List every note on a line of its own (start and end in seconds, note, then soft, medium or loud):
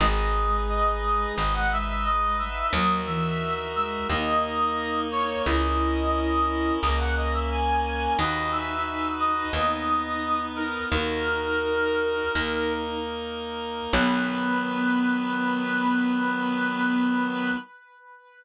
0.00 1.26 G#1 loud
0.00 2.42 G#3 medium
0.00 1.35 D#4 medium
0.00 1.35 G#4 medium
0.00 1.35 B4 medium
0.00 0.57 D#5 loud
0.68 1.32 D#5 medium
1.35 2.63 G#1 medium
1.35 2.70 D#4 medium
1.35 2.70 B4 medium
1.35 2.70 D#5 medium
1.35 1.54 D#5 medium
1.53 1.69 F#5 medium
1.71 1.87 E5 medium
1.88 2.04 E5 medium
2.04 2.37 D#5 medium
2.38 2.66 E5 medium
2.72 3.98 D#2 loud
2.72 3.01 F#3 medium
2.72 4.08 D#4 medium
2.72 4.08 F#4 medium
2.72 4.08 A#4 medium
2.72 3.01 D#5 medium
3.06 3.66 E3 medium
3.06 3.66 E5 medium
3.75 4.08 G#3 medium
3.75 4.07 E5 medium
4.09 5.35 D#2 medium
4.09 5.45 A#3 loud
4.09 5.22 D#4 medium
4.09 5.45 D#4 medium
4.09 5.45 A#4 medium
4.09 5.01 D#5 medium
5.12 5.42 C#5 medium
5.45 6.72 C#2 medium
5.45 6.81 C#4 medium
5.45 6.78 E4 medium
5.45 6.81 E4 medium
5.45 6.81 A#4 medium
5.45 6.11 D#5 medium
6.14 6.73 D#5 medium
6.82 8.08 C#2 medium
6.82 8.17 A#3 medium
6.82 8.17 C#4 medium
6.82 8.17 A#4 medium
6.82 6.98 D#5 medium
6.98 7.14 F#5 medium
7.16 7.32 D#5 medium
7.33 7.49 E5 medium
7.51 7.80 G#5 medium
7.85 8.12 G#5 medium
8.18 9.44 D#2 medium
8.18 9.53 D#4 medium
8.18 10.59 D#4 medium
8.18 9.53 F#4 medium
8.18 9.53 B4 medium
8.18 8.51 D#5 medium
8.51 9.07 E5 medium
9.19 9.52 D#5 medium
9.53 10.79 D#2 medium
9.53 10.89 B3 medium
9.53 10.89 D#4 medium
9.53 10.89 B4 medium
9.53 10.41 D#5 medium
10.56 10.84 A#4 medium
10.90 12.23 D#2 medium
10.90 12.32 D#4 medium
10.90 12.15 D#4 medium
10.90 12.32 F#4 medium
10.90 12.32 A#4 medium
10.90 12.72 A#4 medium
12.34 13.81 D#2 medium
12.34 13.93 A#3 medium
12.34 12.96 D#4 medium
12.34 13.93 D#4 medium
12.34 13.93 A#4 loud
13.93 17.50 B1 loud
13.93 17.51 D#3 medium
13.93 17.51 F#3 loud
13.93 17.50 B3 loud
13.93 17.51 B3 loud
13.93 17.51 B4 loud